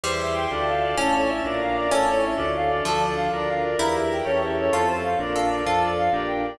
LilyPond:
<<
  \new Staff \with { instrumentName = "Clarinet" } { \time 6/8 \key d \minor \tempo 4. = 128 c''8 e''8 g''8 d''8 f''8 d''8 | a'8 cis''8 e''8 d''8 f''8 d''8 | a'8 cis''8 e''8 d''8 f''8 d''8 | a'8 d''8 f''8 d''8 f''8 d''8 |
bes'8 e''8 g''8 cis''8 e''8 cis''8 | a'8 c''8 f''8 d''8 f''8 d''8 | a'8 d''8 f''8 d''8 g''8 d''8 | }
  \new Staff \with { instrumentName = "Harpsichord" } { \time 6/8 \key d \minor g2. | cis'2~ cis'8 r8 | cis'4. r4. | f2. |
e'2. | f'2 a'4 | f'4. r4. | }
  \new Staff \with { instrumentName = "Electric Piano 2" } { \time 6/8 \key d \minor <e' g' c''>4. <d' f' a'>4. | <cis' e' a'>4. <d' f' bes'>4. | <cis' e' a'>4. <d' f' a'>4. | <d' f' a'>4. <d' f' bes'>4. |
<e' g' bes'>4. <cis' e' g' a'>4. | <c' f' a'>4. <d' f' bes'>4. | <d' f' a'>4. <d' g' bes'>4. | }
  \new Staff \with { instrumentName = "Drawbar Organ" } { \clef bass \time 6/8 \key d \minor e,4. d,4. | a,,4. bes,,4. | a,,4. d,4. | d,4. d,4. |
e,4. e,4. | f,4. bes,,4. | f,4. bes,,4. | }
  \new Staff \with { instrumentName = "String Ensemble 1" } { \time 6/8 \key d \minor <e'' g'' c'''>4. <d'' f'' a''>4. | <cis'' e'' a''>4. <d'' f'' bes''>4. | <cis' e' a'>4. <d' f' a'>4. | <d' f' a'>4. <d' f' bes'>4. |
<e' g' bes'>4. <cis' e' g' a'>4. | <c' f' a'>4. <d' f' bes'>4. | <d' f' a'>4. <d' g' bes'>4. | }
>>